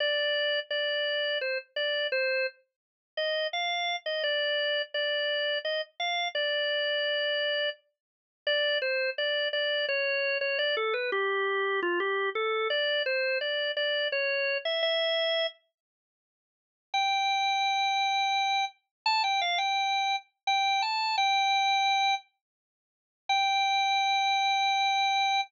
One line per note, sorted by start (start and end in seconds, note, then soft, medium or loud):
0.00 0.60 D5 medium
0.70 1.38 D5 medium
1.41 1.58 C5 medium
1.76 2.07 D5 medium
2.12 2.46 C5 medium
3.17 3.47 D#5 medium
3.53 3.96 F5 medium
4.06 4.23 D#5 medium
4.23 4.82 D5 medium
4.94 5.59 D5 medium
5.65 5.81 D#5 medium
6.00 6.28 F5 medium
6.35 7.70 D5 medium
8.47 8.78 D5 loud
8.82 9.10 C5 medium
9.18 9.48 D5 medium
9.53 9.86 D5 medium
9.89 10.38 C#5 medium
10.41 10.58 C#5 medium
10.59 10.75 D5 medium
10.77 10.94 A4 medium
10.94 11.10 B4 medium
11.12 11.80 G4 medium
11.82 11.99 F4 medium
12.00 12.30 G4 medium
12.35 12.68 A4 medium
12.70 13.03 D5 medium
13.06 13.38 C5 medium
13.41 13.72 D5 medium
13.77 14.08 D5 medium
14.12 14.58 C#5 medium
14.65 14.82 E5 medium
14.83 15.47 E5 loud
16.94 18.65 G5 medium
19.06 19.22 A5 loud
19.24 19.40 G5 medium
19.41 19.58 F5 medium
19.58 20.16 G5 medium
20.47 20.82 G5 loud
20.82 21.16 A5 medium
21.18 22.15 G5 loud
23.29 25.41 G5 loud